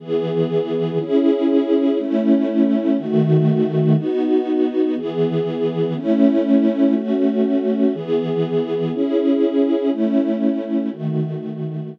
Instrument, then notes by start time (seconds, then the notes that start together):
string ensemble 1
0.00 E3 B3 G#4
1.00 C#4 E4 G#4
1.99 A3 C#4 E4
2.98 D#3 A3 F#4
3.97 B3 D#4 F#4
4.96 E3 B3 G#4
5.96 A3 C#4 E4
6.95 A3 C#4 F#4
7.94 E3 B3 G#4
8.93 C#4 E4 G#4
9.91 A3 C#4 E4
10.91 D#3 A3 F#4